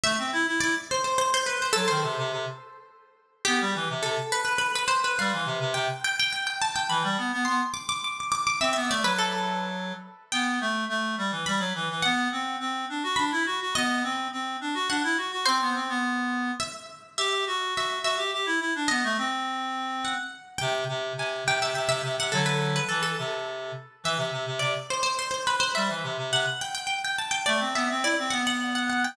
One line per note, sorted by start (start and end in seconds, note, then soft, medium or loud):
0.03 0.17 A3 medium
0.03 0.50 E5 loud
0.18 0.32 C4 medium
0.33 0.46 E4 medium
0.47 0.60 E4 medium
0.60 0.75 E4 medium
0.60 0.85 D5 medium
0.91 1.04 C5 medium
1.04 1.18 C5 medium
1.18 1.32 C5 medium
1.34 1.47 C5 medium
1.46 1.60 B4 medium
1.62 1.75 C5 medium
1.73 1.88 F#3 medium
1.73 1.86 A4 medium
1.88 2.03 D#3 medium
1.88 2.94 C5 medium
2.03 2.16 C3 medium
2.18 2.31 C3 medium
2.32 2.45 C3 medium
3.45 3.60 B3 medium
3.45 3.98 G4 medium
3.61 3.74 G3 medium
3.75 3.88 E3 medium
3.90 4.03 C3 medium
4.03 4.17 C3 medium
4.03 4.29 A4 medium
4.32 4.44 B4 medium
4.45 4.58 B4 medium
4.58 4.72 B4 medium
4.75 4.89 B4 medium
4.88 5.01 C5 medium
5.04 5.18 B4 medium
5.19 5.32 G3 medium
5.19 5.68 F5 medium
5.33 5.47 E3 medium
5.46 5.59 C3 medium
5.60 5.73 C3 medium
5.74 5.88 C3 medium
5.74 6.01 G5 medium
6.04 6.18 G5 medium
6.19 6.32 G5 medium
6.32 6.46 G5 medium
6.47 6.60 G5 medium
6.62 6.75 A5 medium
6.76 6.89 G5 medium
6.89 7.03 E3 medium
6.89 7.44 B5 medium
7.03 7.17 G3 medium
7.18 7.31 B3 medium
7.33 7.46 B3 medium
7.45 7.61 B3 medium
7.45 7.73 C6 medium
7.74 7.87 D6 medium
7.89 8.02 D6 medium
8.04 8.18 D6 medium
8.20 8.31 D6 medium
8.32 8.45 D6 medium
8.47 8.60 D6 medium
8.60 8.74 C4 medium
8.60 8.72 E5 loud
8.73 8.89 B3 medium
8.73 8.86 E5 medium
8.89 9.03 A3 medium
8.89 9.04 D5 medium
9.03 9.93 F#3 medium
9.03 9.18 B4 medium
9.18 9.66 A4 medium
10.32 10.59 B3 medium
10.32 11.39 G5 medium
10.61 10.85 A3 medium
10.89 11.15 A3 medium
11.18 11.31 G3 medium
11.32 11.45 E3 medium
11.46 11.60 G3 medium
11.46 12.01 B5 medium
11.60 11.73 F#3 medium
11.75 11.89 E3 medium
11.90 12.04 E3 medium
12.02 12.28 B3 medium
12.02 13.14 F#5 medium
12.32 12.56 C4 medium
12.60 12.85 C4 medium
12.89 13.03 D4 medium
13.03 13.17 F#4 medium
13.16 13.31 D4 medium
13.16 13.62 B5 medium
13.32 13.45 E4 medium
13.46 13.59 F#4 medium
13.60 13.74 F#4 medium
13.75 14.03 B3 medium
13.75 14.85 D#5 medium
14.03 14.28 C4 medium
14.32 14.57 C4 medium
14.61 14.74 D4 medium
14.74 14.88 F#4 medium
14.89 15.03 D4 medium
14.89 15.38 F#5 medium
15.04 15.17 E4 medium
15.17 15.31 F#4 medium
15.32 15.45 F#4 medium
15.45 15.60 C4 medium
15.45 16.56 C5 medium
15.61 15.75 B3 medium
15.75 15.89 C4 medium
15.89 16.51 B3 medium
16.60 17.09 E5 medium
17.18 17.44 G4 medium
17.18 17.69 E5 medium
17.47 17.74 F#4 medium
17.75 17.99 F#4 medium
17.75 18.04 E5 medium
18.03 18.17 F#4 medium
18.03 18.60 E5 medium
18.17 18.31 G4 medium
18.33 18.46 G4 medium
18.46 18.60 E4 medium
18.60 18.74 E4 medium
18.75 18.89 D4 medium
18.88 19.03 B3 medium
18.88 19.98 D#5 medium
19.04 19.17 A3 medium
19.18 20.14 C4 medium
20.05 20.52 F#5 medium
20.58 20.84 C3 medium
20.58 21.13 G5 medium
20.89 21.13 C3 medium
21.17 21.44 C3 medium
21.17 21.47 G#5 medium
21.46 21.59 C3 medium
21.46 21.61 G5 medium
21.60 21.73 C3 medium
21.60 21.75 E5 medium
21.75 21.88 C3 medium
21.75 21.88 E5 medium
21.88 22.02 C3 medium
21.88 22.02 E5 medium
22.03 22.17 C3 medium
22.18 22.32 C3 medium
22.18 22.33 F#5 medium
22.32 22.80 D3 medium
22.32 22.80 F#3 medium
22.32 22.45 A4 medium
22.46 22.59 B4 medium
22.76 22.89 B4 medium
22.89 23.15 E3 medium
22.89 23.02 A4 medium
23.03 23.71 A4 medium
23.18 23.72 C3 medium
24.04 24.17 E3 medium
24.04 24.51 E5 medium
24.17 24.31 C3 medium
24.32 24.46 C3 medium
24.46 24.60 C3 medium
24.59 24.74 C3 medium
24.59 24.87 D5 medium
24.90 25.02 C5 medium
25.03 25.16 C5 medium
25.19 25.30 C5 medium
25.31 25.44 C5 medium
25.47 25.60 B4 medium
25.60 25.73 C5 medium
25.75 25.89 G3 medium
25.75 26.30 E5 medium
25.89 26.03 E3 medium
26.03 26.17 C3 medium
26.18 26.31 C3 medium
26.32 26.45 C3 medium
26.32 26.59 F#5 medium
26.61 26.74 G5 medium
26.75 26.86 G5 medium
26.87 27.00 G5 medium
27.04 27.18 G5 medium
27.18 27.32 A5 medium
27.31 27.45 G5 medium
27.46 27.60 A3 medium
27.46 27.72 D5 medium
27.60 27.74 C4 medium
27.75 27.88 B3 medium
27.75 27.89 E5 medium
27.90 28.04 C4 medium
28.03 28.17 E4 medium
28.03 28.30 D5 medium
28.19 28.32 C4 medium
28.30 29.06 B3 medium
28.30 28.44 F#5 medium
28.47 28.60 F#5 medium
28.75 28.89 F#5 medium
28.89 29.03 F#5 medium
29.04 29.16 G5 medium